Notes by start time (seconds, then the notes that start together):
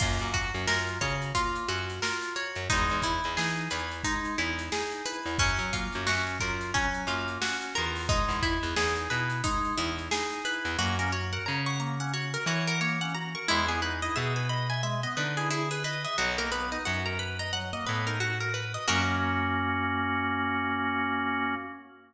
0.00 F#2 A#3 F4, kick, crash
0.19 F#2, closed hi-hat
0.34 F#4, kick, closed hi-hat
0.54 F#2, closed hi-hat
0.67 F#2 F4 A#4, snare
0.87 closed hi-hat
1.01 C#3 F#4 C#5, kick, closed hi-hat
1.22 closed hi-hat
1.35 A#3 F4, kick, closed hi-hat
1.55 closed hi-hat
1.69 F#2 F#4, closed hi-hat
1.90 closed hi-hat
2.02 F4 A#4, snare
2.22 closed hi-hat
2.36 F#4 C#5, closed hi-hat
2.55 F#2, closed hi-hat
2.69 E2 G#3 D#4, kick, closed hi-hat
2.90 E2, closed hi-hat
3.02 E4, kick, closed hi-hat
3.24 E2, closed hi-hat
3.37 E3 D#4 G#4, snare
3.56 closed hi-hat
3.70 E2 E4 B4, closed hi-hat
3.91 closed hi-hat
4.04 G#3 D#4, kick, closed hi-hat
4.24 snare, closed hi-hat
4.38 E2 E4, closed hi-hat
4.59 closed hi-hat
4.72 D#4 G#4, snare
4.92 closed hi-hat
5.05 E4 B4, closed hi-hat
5.26 E2, closed hi-hat
5.38 F#2 F#3 C#4, kick, closed hi-hat
5.59 F#3, closed hi-hat
5.73 A#3 F4, kick, closed hi-hat
5.93 F#2, closed hi-hat
6.07 F#2 C#4 F#4, snare
6.27 snare, closed hi-hat
6.40 F#2 F4 A#4, kick, closed hi-hat
6.61 snare, closed hi-hat
6.74 F#3 C#4, kick, closed hi-hat
6.94 closed hi-hat
7.07 F#2 A#3 F4, closed hi-hat
7.28 closed hi-hat
7.42 C#4 F#4, snare
7.61 snare, closed hi-hat
7.75 E2 F4 A#4, closed hi-hat
7.96 open hi-hat
8.09 G#3 D#4, kick, closed hi-hat
8.28 E2, snare, closed hi-hat
8.42 E4, kick, closed hi-hat
8.63 E2, closed hi-hat
8.76 E2 D#4 G#4, snare
8.96 closed hi-hat
9.10 B2 E4 B4, closed hi-hat
9.30 closed hi-hat
9.44 G#3 D#4, kick, closed hi-hat
9.65 closed hi-hat
9.77 E2 E4, closed hi-hat
9.99 closed hi-hat
10.11 D#4 G#4, snare
10.31 snare, closed hi-hat
10.45 E4 B4, closed hi-hat
10.65 E2, closed hi-hat
10.79 F#2 A#3 F#4
10.99 C#4 A#4
11.12 F#4 C#5
11.33 A#4 F#5
11.46 C#3 C#5 A#5
11.66 F#5 C#6
11.80 A#3 A#5
12.00 C#4 F#5
12.13 F#4 C#5
12.34 A#4
12.46 E3 F#4 C#5
12.67 A#4 F#5
12.81 A#3 C#5
13.01 C#4 F#5
13.15 F#4 A#5
13.35 A#4 C#6
13.48 E2 G#3 E4
13.68 B3 G#4
13.82 D#4 B4
14.02 E4 D#5
14.16 B2 G#4 E5
14.36 B4 G#5
14.49 D#5 B5
14.70 E5 G#5
14.83 G#3 E5
15.03 B3 D#5
15.17 D3 D#4 B4
15.37 E4 G#4
15.51 E4 G#4
15.71 G#4 B4
15.84 B4 D#5
16.04 D#5 E5
16.18 B1 F#3 F#4
16.38 A#3 A#4
16.52 B3 B4
16.72 D#4 D#5
16.85 F#2 F#4 F#5
17.06 A#4 A#5
17.19 B4 B5
17.39 D#5 A#5
17.53 F#3 F#5
17.73 A#3 D#5
17.87 A2 B3 B4
18.07 D#4 A#4
18.20 F#4
18.40 A#4
18.54 B4
18.74 D#5
18.87 F#2 A#3 C#4 F#4 A#4 C#5